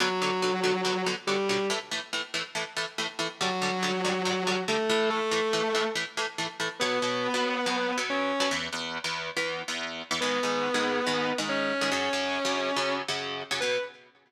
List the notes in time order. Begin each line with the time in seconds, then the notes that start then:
0.00 B2 D3 F#3 F#4
0.22 B2 D3 F#3
0.42 B2 D3 F#3
0.64 B2 D3 F#3
0.85 B2 D3 F#3
1.06 B2 D3 F#3
1.27 B2 D3 F#3 G3 G4
1.49 B2 D3 F#3
1.70 A2 E3 A3
1.91 A2 E3 A3
2.13 A2 E3 A3
2.34 A2 E3 A3
2.55 A2 E3 A3
2.77 A2 E3 A3
2.98 A2 E3 A3
3.19 A2 E3 A3
3.41 G2 D3 F#3 G3 F#4
3.62 G2 D3 G3
3.83 G2 D3 G3
4.05 G2 D3 G3
4.25 G2 D3 G3
4.47 G2 D3 G3
4.68 G2 D3 G3 A3 A4
4.90 A2 E3 A3
5.10 A3 A4
5.31 A2 E3 A3
5.53 A2 E3 A3
5.75 A2 E3 A3
5.95 A2 E3 A3
6.17 A2 E3 A3
6.38 A2 E3 A3
6.60 A2 E3 A3
6.80 B2 F#3 B3 B4
7.02 B2 F#3 B3
7.34 B2 F#3 B3
7.66 B2 F#3 B3
7.98 B2 F#3 B3
8.10 C#4 C#5
8.40 B2 F#3 B3
8.51 E2 E3 B3
8.73 E2 E3 B3
9.04 E2 E3 B3
9.37 E2 E3 B3
9.68 E2 E3 B3
10.11 E2 E3 B3
10.21 G#2 D#3 G#3 B3 B4
10.43 G#2 D#3 G#3
10.74 G#2 D#3 G#3
11.07 G#2 D#3 G#3
11.38 G#2 D#3 G#3
11.49 C#4 C#5
11.81 G#2 D#3 G#3
11.92 F#2 C#3 F#3 C#4 C#5
12.13 F#2 C#3 F#3
12.45 F#2 C#3 F#3
12.76 F#2 C#3 F#3
13.08 F#2 C#3 F#3
13.51 F#2 C#3 F#3
13.60 B2 F#3 B3 B4